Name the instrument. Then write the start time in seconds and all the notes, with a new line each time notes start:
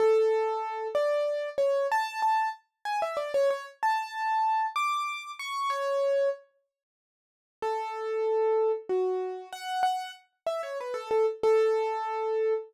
acoustic grand piano
0.00 A4
0.95 D5
1.58 C#5
1.92 A5
2.22 A5
2.85 G#5
3.02 E5
3.17 D5
3.34 C#5
3.51 C#5
3.83 A5
4.76 D6
5.39 C#6
5.70 C#5
7.62 A4
8.89 F#4
9.53 F#5
9.83 F#5
10.47 E5
10.63 C#5
10.81 B4
10.94 A4
11.11 A4
11.43 A4